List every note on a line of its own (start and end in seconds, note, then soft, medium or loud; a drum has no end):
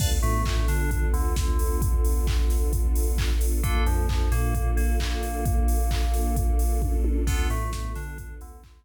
0.00 0.20 D2 loud
0.00 3.60 B3 medium
0.00 3.60 D4 medium
0.00 3.60 F4 medium
0.00 3.60 A4 medium
0.00 0.09 B4 medium
0.00 0.09 D5 loud
0.00 0.09 F5 medium
0.00 0.09 A5 medium
0.00 kick loud
0.00 crash loud
0.22 0.43 A2 loud
0.22 0.42 A3 loud
0.22 open hi-hat medium
0.45 0.65 A2 medium
0.45 0.65 A3 medium
0.45 kick loud
0.45 clap loud
0.68 1.07 D3 medium
0.68 1.07 D4 medium
0.68 snare medium
0.68 open hi-hat medium
0.91 kick loud
0.91 closed hi-hat loud
1.13 1.33 D2 loud
1.13 1.33 D3 medium
1.13 open hi-hat medium
1.36 3.30 D2 loud
1.36 3.30 D3 medium
1.36 kick loud
1.36 snare loud
1.59 open hi-hat loud
1.82 kick loud
1.82 closed hi-hat loud
2.05 open hi-hat loud
2.27 kick loud
2.27 clap loud
2.50 snare medium
2.50 open hi-hat medium
2.73 kick loud
2.73 closed hi-hat loud
2.95 open hi-hat loud
3.18 kick loud
3.18 clap loud
3.41 open hi-hat loud
3.63 3.83 A#1 loud
3.63 3.84 A#3 medium
3.63 7.24 A#3 medium
3.63 3.84 D4 medium
3.63 7.24 D4 medium
3.63 3.84 F4 medium
3.63 7.24 F4 medium
3.63 3.84 A4 medium
3.63 7.24 A4 medium
3.63 kick loud
3.63 closed hi-hat loud
3.86 4.06 F2 loud
3.86 4.06 F3 medium
3.86 open hi-hat medium
4.09 4.28 F2 medium
4.09 4.29 F3 medium
4.09 kick loud
4.09 clap loud
4.32 4.71 A#2 loud
4.32 4.70 A#3 loud
4.32 snare medium
4.32 open hi-hat medium
4.55 kick loud
4.55 closed hi-hat loud
4.77 4.96 A#1 loud
4.77 4.96 A#3 loud
4.77 open hi-hat medium
5.00 6.93 A#1 medium
5.00 6.93 A#3 medium
5.00 kick medium
5.00 clap loud
5.23 open hi-hat medium
5.45 kick loud
5.45 closed hi-hat loud
5.68 open hi-hat loud
5.91 kick loud
5.91 clap loud
6.14 snare medium
6.14 open hi-hat medium
6.36 kick loud
6.36 closed hi-hat loud
6.59 open hi-hat loud
6.82 kick loud
6.82 high tom medium
7.04 high tom loud
7.27 7.47 D2 loud
7.27 7.47 B3 loud
7.27 8.85 B3 medium
7.27 7.47 D4 medium
7.27 8.85 D4 medium
7.27 7.47 F4 medium
7.27 8.85 F4 medium
7.27 7.47 A4 medium
7.27 8.85 A4 medium
7.27 kick loud
7.27 crash loud
7.50 7.69 A2 loud
7.50 7.70 A3 loud
7.50 open hi-hat medium
7.73 7.92 A2 loud
7.73 7.92 A3 medium
7.73 kick loud
7.73 snare loud
7.95 8.34 D3 medium
7.95 8.34 D4 medium
7.95 snare medium
7.95 open hi-hat medium
8.18 kick loud
8.18 closed hi-hat loud
8.41 8.60 D2 loud
8.41 8.61 D3 medium
8.41 open hi-hat loud
8.64 8.85 D2 loud
8.64 8.85 D3 medium
8.64 kick loud
8.64 clap loud